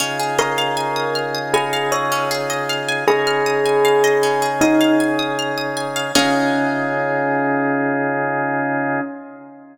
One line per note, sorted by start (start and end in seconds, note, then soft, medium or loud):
0.00 3.05 C#3 medium
0.00 0.17 C#4 medium
0.00 3.05 D#4 medium
0.00 3.05 F4 medium
0.00 3.05 G#4 medium
0.19 0.37 G#4 medium
0.38 1.12 A#4 medium
0.38 0.56 D#5 medium
0.58 0.75 F5 medium
0.77 0.94 G#5 medium
0.96 1.13 D#6 medium
1.15 1.33 F6 medium
1.35 1.52 D#6 medium
1.54 1.88 G#4 medium
1.54 1.71 G#5 loud
1.73 1.90 F5 medium
1.92 2.23 C#5 medium
1.92 2.09 D#5 medium
2.12 2.29 C#4 medium
2.31 2.48 G#4 medium
2.50 2.67 D#5 medium
2.69 2.87 F5 medium
2.88 3.06 G#5 medium
3.07 6.12 C#3 medium
3.07 6.12 C#4 medium
3.07 6.12 D#4 medium
3.07 6.12 G#4 medium
3.07 4.49 G#4 loud
3.07 3.25 D#6 medium
3.27 3.44 F6 medium
3.46 3.64 D#6 medium
3.66 3.83 G#5 medium
3.85 4.02 F5 medium
4.04 4.21 D#5 medium
4.23 4.40 C#4 medium
4.42 4.59 G#4 medium
4.61 4.94 D#4 loud
4.61 4.79 D#5 medium
4.81 4.98 F5 medium
5.00 5.17 G#5 medium
5.19 5.36 D#6 medium
5.39 5.56 F6 medium
5.58 5.75 D#6 medium
5.77 5.94 G#5 medium
5.96 6.13 F5 medium
6.15 9.00 C#3 loud
6.15 9.01 C#4 loud
6.15 9.00 D#4 loud
6.15 9.00 F4 loud
6.15 9.00 G#4 loud
6.15 9.01 G#4 loud
6.15 9.01 D#5 loud
6.15 9.01 F5 loud